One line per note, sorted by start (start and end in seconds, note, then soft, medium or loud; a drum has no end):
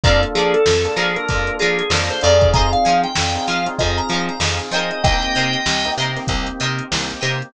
0.03 0.25 F2 loud
0.03 0.56 A#3 loud
0.03 0.56 D4 loud
0.03 0.56 F4 loud
0.03 0.56 A4 loud
0.03 0.21 D5 medium
0.03 0.17 D5 loud
0.03 0.17 F5 loud
0.03 0.17 A5 loud
0.03 0.17 A#5 loud
0.03 kick loud
0.03 closed hi-hat medium
0.23 closed hi-hat medium
0.35 0.55 F3 medium
0.35 0.53 G#4 medium
0.35 0.59 D5 loud
0.35 0.59 F5 medium
0.35 0.59 A5 medium
0.35 0.59 A#5 loud
0.35 closed hi-hat medium
0.54 0.95 A4 medium
0.54 closed hi-hat medium
0.66 0.87 F2 medium
0.66 snare loud
0.85 1.08 A#3 medium
0.85 1.08 D4 medium
0.85 1.08 F4 medium
0.85 1.08 A4 medium
0.85 closed hi-hat medium
0.96 1.17 F3 medium
0.96 1.15 G#4 medium
0.96 1.20 D5 loud
0.96 1.20 F5 medium
0.96 1.20 A5 medium
0.96 1.20 A#5 loud
0.96 closed hi-hat medium
1.16 1.26 A#3 medium
1.16 1.26 D4 medium
1.16 1.26 F4 medium
1.16 1.26 A4 medium
1.16 1.53 A#4 medium
1.16 closed hi-hat medium
1.29 1.50 F2 medium
1.29 1.81 A#3 medium
1.29 1.81 D4 medium
1.29 1.81 F4 loud
1.29 1.81 A4 medium
1.29 kick medium
1.29 closed hi-hat medium
1.47 closed hi-hat medium
1.59 1.82 F3 medium
1.59 1.78 G#4 medium
1.59 1.83 D5 medium
1.59 1.83 F5 medium
1.59 1.83 A5 medium
1.59 1.83 A#5 medium
1.59 closed hi-hat medium
1.79 1.90 G#4 medium
1.79 closed hi-hat medium
1.90 2.10 F2 medium
1.90 2.17 A#3 medium
1.90 2.17 D4 medium
1.90 2.17 F4 medium
1.90 2.17 A4 medium
1.90 2.09 A#4 medium
1.90 snare loud
2.10 2.21 C5 medium
2.10 closed hi-hat medium
2.21 2.75 F2 loud
2.21 3.06 C4 loud
2.21 3.06 D#4 loud
2.21 3.06 F4 medium
2.21 3.06 G#4 loud
2.21 2.49 D5 medium
2.21 2.36 D5 medium
2.21 2.36 F5 medium
2.21 2.36 A5 medium
2.21 2.36 A#5 medium
2.21 closed hi-hat medium
2.41 kick medium
2.41 closed hi-hat medium
2.54 2.67 C5 loud
2.54 2.67 D#5 loud
2.54 2.67 F5 loud
2.54 2.67 G#5 loud
2.54 2.71 A#5 medium
2.54 kick loud
2.54 closed hi-hat medium
2.72 2.98 F5 medium
2.72 closed hi-hat medium
2.85 3.06 F3 medium
2.85 3.09 C5 medium
2.85 3.09 D#5 medium
2.85 3.09 F5 medium
2.85 3.09 G#5 medium
2.85 closed hi-hat medium
3.04 3.44 G5 medium
3.04 closed hi-hat medium
3.15 3.38 F2 medium
3.15 snare loud
3.35 3.58 C4 loud
3.35 3.58 D#4 medium
3.35 3.58 F4 medium
3.35 3.58 G#4 medium
3.35 closed hi-hat medium
3.47 3.68 F3 medium
3.47 3.72 C5 medium
3.47 3.72 D#5 medium
3.47 3.65 F5 medium
3.47 3.72 F5 medium
3.47 3.72 G#5 medium
3.47 snare soft
3.47 closed hi-hat medium
3.66 3.76 C4 medium
3.66 3.76 D#4 medium
3.66 3.76 F4 medium
3.66 3.76 G#4 medium
3.66 closed hi-hat medium
3.79 4.00 F2 loud
3.79 4.31 C4 loud
3.79 4.31 D#4 medium
3.79 4.31 F4 medium
3.79 4.31 G#4 medium
3.79 3.96 D#5 medium
3.79 kick medium
3.79 closed hi-hat medium
3.97 4.22 A#5 medium
3.97 closed hi-hat medium
4.09 4.30 F3 medium
4.09 4.35 F5 medium
4.09 4.35 G#5 medium
4.09 closed hi-hat medium
4.13 4.35 C5 medium
4.13 4.35 D#5 medium
4.29 4.40 A#5 medium
4.29 closed hi-hat medium
4.40 4.60 F2 medium
4.40 4.67 C4 medium
4.40 4.67 D#4 medium
4.40 4.67 F4 medium
4.40 4.67 G#4 medium
4.40 snare loud
4.59 closed hi-hat medium
4.71 4.91 F3 medium
4.71 4.99 C4 medium
4.71 4.99 D#4 medium
4.71 4.99 F4 medium
4.71 4.99 G#4 medium
4.71 5.17 A#4 loud
4.71 5.17 C5 loud
4.71 4.90 D#5 medium
4.71 5.17 D#5 loud
4.71 5.17 G5 loud
4.71 closed hi-hat medium
4.91 5.03 D#5 medium
4.91 closed hi-hat medium
5.03 5.24 C2 medium
5.03 5.56 A#3 loud
5.03 5.56 C4 loud
5.03 5.56 D#4 medium
5.03 5.56 G4 loud
5.03 5.91 D#5 medium
5.03 5.91 G5 medium
5.03 kick loud
5.03 closed hi-hat loud
5.22 snare soft
5.22 closed hi-hat medium
5.35 5.56 C3 medium
5.35 5.59 A#4 medium
5.35 5.59 C5 medium
5.35 5.59 D#5 medium
5.35 5.59 G5 medium
5.35 closed hi-hat medium
5.53 closed hi-hat medium
5.66 5.86 C2 medium
5.66 snare loud
5.85 6.09 A#3 medium
5.85 6.09 C4 medium
5.85 6.09 D#4 loud
5.85 6.09 G4 medium
5.85 closed hi-hat medium
5.98 6.18 C3 medium
5.98 6.22 A#4 medium
5.98 6.22 C5 medium
5.98 6.22 D#5 medium
5.98 6.22 G5 loud
5.98 closed hi-hat medium
6.16 6.26 A#3 medium
6.16 6.26 C4 loud
6.16 6.26 D#4 medium
6.16 6.26 G4 medium
6.16 snare soft
6.16 closed hi-hat medium
6.27 6.49 C2 medium
6.27 6.81 A#3 medium
6.27 6.81 C4 medium
6.27 6.81 D#4 medium
6.27 6.81 G4 medium
6.27 kick medium
6.27 closed hi-hat loud
6.46 closed hi-hat medium
6.60 6.81 C3 medium
6.60 6.84 A#4 medium
6.60 6.84 C5 medium
6.60 6.84 D#5 medium
6.60 6.84 G5 medium
6.60 closed hi-hat medium
6.79 closed hi-hat medium
6.91 7.12 C2 medium
6.91 7.17 A#3 medium
6.91 7.17 C4 medium
6.91 7.17 D#4 medium
6.91 7.17 G4 medium
6.91 snare loud
7.10 closed hi-hat medium
7.21 7.43 C3 medium
7.21 7.48 A#3 medium
7.21 7.48 C4 medium
7.21 7.48 D#4 medium
7.21 7.48 G4 medium
7.21 7.34 A#4 medium
7.21 7.34 C5 medium
7.21 7.34 D#5 medium
7.21 7.34 G5 medium
7.21 closed hi-hat medium
7.42 closed hi-hat medium